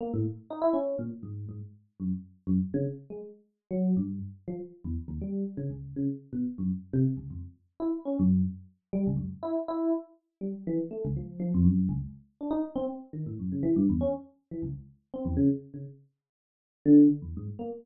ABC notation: X:1
M:9/8
L:1/16
Q:3/8=81
K:none
V:1 name="Electric Piano 1"
^A, =A,, z2 ^D E ^C2 ^A,, z ^G,,2 G,, z3 ^F,, z | z2 ^F,, z ^C, z2 ^G, z4 ^F,2 =G,,2 z2 | F, z2 E,, z ^D,, G,2 z ^C, ^C,,2 C, z2 B,, z ^F,, | z2 C, z ^C,, F,, z3 E z ^C ^F,,2 z4 |
G, ^C,, ^F,, z E z E2 z4 G, z E, z A, C,, | F,2 F, F,, ^F,,2 ^C,, z3 D ^D z =C z2 ^D, A,, | ^F,, ^C, E, G,, E,, ^C z3 E, ^C,, z3 =C E,, ^C, z | z ^C, z8 D,2 z E,, ^G,, z ^A, z |]